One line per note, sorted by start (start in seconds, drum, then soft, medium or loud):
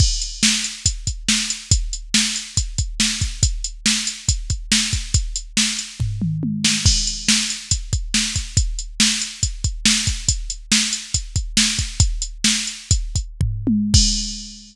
0.00 kick loud
0.00 crash medium
0.22 closed hi-hat medium
0.43 snare loud
0.64 closed hi-hat medium
0.86 kick medium
0.86 closed hi-hat loud
1.07 kick medium
1.07 closed hi-hat medium
1.28 snare medium
1.50 closed hi-hat medium
1.71 kick loud
1.71 closed hi-hat loud
1.93 closed hi-hat medium
2.14 snare loud
2.36 closed hi-hat medium
2.57 kick medium
2.57 closed hi-hat medium
2.78 kick medium
2.78 closed hi-hat medium
3.00 snare medium
3.21 kick medium
3.21 closed hi-hat medium
3.43 kick medium
3.43 closed hi-hat loud
3.64 closed hi-hat medium
3.86 snare medium
4.07 closed hi-hat medium
4.29 kick medium
4.29 closed hi-hat medium
4.50 kick medium
4.50 closed hi-hat medium
4.72 snare loud
4.93 kick medium
4.93 closed hi-hat medium
5.14 kick medium
5.14 closed hi-hat medium
5.36 closed hi-hat medium
5.57 snare medium
5.79 closed hi-hat medium
6.00 kick medium
6.00 floor tom medium
6.22 mid tom medium
6.43 high tom medium
6.64 snare medium
6.86 kick loud
6.86 crash loud
7.07 closed hi-hat medium
7.28 snare loud
7.50 closed hi-hat medium
7.71 kick medium
7.71 closed hi-hat medium
7.93 kick medium
7.93 closed hi-hat medium
8.14 snare medium
8.36 kick medium
8.36 closed hi-hat medium
8.57 kick loud
8.57 closed hi-hat medium
8.79 closed hi-hat medium
9.00 snare loud
9.22 closed hi-hat medium
9.43 kick medium
9.43 closed hi-hat medium
9.64 kick medium
9.64 closed hi-hat medium
9.85 snare loud
10.07 kick medium
10.07 closed hi-hat medium
10.28 kick medium
10.28 closed hi-hat loud
10.50 closed hi-hat medium
10.72 snare loud
10.93 closed hi-hat medium
11.14 kick medium
11.14 closed hi-hat medium
11.36 kick medium
11.36 closed hi-hat medium
11.57 snare loud
11.79 kick medium
11.79 closed hi-hat medium
12.00 kick loud
12.00 closed hi-hat medium
12.22 closed hi-hat medium
12.44 snare loud
12.67 closed hi-hat medium
12.91 kick medium
12.91 closed hi-hat medium
13.16 kick medium
13.16 closed hi-hat medium
13.41 kick medium
13.41 floor tom medium
13.67 high tom loud
13.94 kick loud
13.94 crash loud